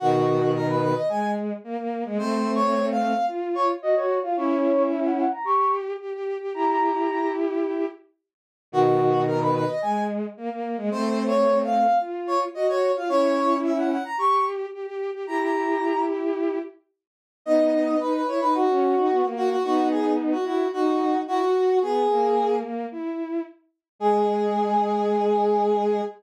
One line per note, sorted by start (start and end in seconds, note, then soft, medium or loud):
0.00 0.93 B2 loud
0.00 0.93 D#3 loud
0.00 0.51 F#4 loud
0.54 0.67 A#4 loud
0.69 0.81 B4 medium
0.82 0.95 B4 loud
0.95 1.08 D#5 medium
1.09 1.53 G#3 medium
1.09 1.31 G#5 loud
1.64 1.77 A#3 loud
1.78 2.04 A#3 medium
2.05 2.18 G#3 loud
2.18 3.13 A3 loud
2.18 3.13 C4 loud
2.18 2.51 C5 loud
2.54 2.86 C#5 loud
2.91 3.26 F5 loud
3.28 3.73 F4 medium
3.55 3.68 C#5 loud
3.82 3.95 F#4 loud
3.82 3.95 D#5 medium
3.95 4.19 F#4 loud
3.95 4.19 C#5 loud
4.23 4.36 F4 medium
4.23 4.36 F5 medium
4.37 5.25 C#4 loud
4.37 5.25 E4 loud
4.37 4.83 C#5 loud
4.91 5.04 E5 medium
5.04 5.17 F#5 medium
5.18 5.31 F#5 medium
5.32 5.45 A#5 medium
5.44 5.93 G4 loud
5.44 5.71 C#6 medium
6.00 6.13 G4 medium
6.14 6.38 G4 loud
6.40 6.53 G4 loud
6.54 7.86 E4 medium
6.54 7.86 G4 loud
6.54 6.67 A#5 medium
6.69 7.29 A#5 medium
8.72 9.64 B2 loud
8.72 9.64 D#3 loud
8.72 9.24 F#4 loud
9.27 9.40 A#4 loud
9.41 9.54 B4 medium
9.55 9.68 B4 loud
9.68 9.81 D#5 medium
9.82 10.26 G#3 medium
9.82 10.04 G#5 loud
10.37 10.50 A#3 loud
10.50 10.77 A#3 medium
10.77 10.90 G#3 loud
10.91 11.86 A3 loud
10.91 11.86 C4 loud
10.91 11.24 C5 loud
11.27 11.58 C#5 loud
11.64 11.98 F5 loud
12.00 12.45 F4 medium
12.27 12.40 C#5 loud
12.54 12.68 F#4 loud
12.54 12.67 D#5 medium
12.68 12.91 F#4 loud
12.68 12.92 C#5 loud
12.95 13.08 F4 medium
12.95 13.09 F5 medium
13.09 13.98 C#4 loud
13.09 13.98 E4 loud
13.09 13.55 C#5 loud
13.64 13.76 E5 medium
13.77 13.90 F#5 medium
13.91 14.04 F#5 medium
14.05 14.18 A#5 medium
14.18 14.66 G4 loud
14.18 14.45 C#6 medium
14.73 14.86 G4 medium
14.87 15.11 G4 loud
15.13 15.26 G4 loud
15.27 16.59 E4 medium
15.27 16.59 G4 loud
15.27 15.40 A#5 medium
15.41 16.01 A#5 medium
17.46 17.96 B3 loud
17.46 17.96 D#4 loud
17.46 17.98 D#5 loud
18.00 18.22 D#4 medium
18.00 18.13 B4 medium
18.14 18.27 B4 medium
18.28 18.41 E4 medium
18.28 18.40 C#5 medium
18.41 18.66 D#4 medium
18.41 18.54 B4 loud
18.54 19.26 F#4 medium
18.69 18.95 C#4 loud
18.96 19.09 D#4 loud
19.10 19.23 B3 loud
19.23 19.56 A#3 loud
19.36 19.49 F#4 loud
19.50 19.63 F#4 loud
19.64 20.34 B3 medium
19.64 20.34 D#4 loud
19.64 19.88 F#4 loud
19.91 20.12 G#4 medium
20.32 20.45 F#4 medium
20.44 20.66 E4 loud
20.44 20.68 F#4 medium
20.73 21.20 D#4 loud
20.73 21.18 F#4 loud
21.28 21.41 E4 loud
21.28 21.79 F#4 loud
21.41 21.54 F#4 loud
21.54 21.79 F#4 medium
21.82 22.07 B3 loud
21.82 22.56 G#4 loud
22.10 22.63 A#3 loud
22.63 22.86 A#3 medium
22.92 23.42 E4 medium
23.99 26.01 G#3 loud
23.99 26.01 G#4 loud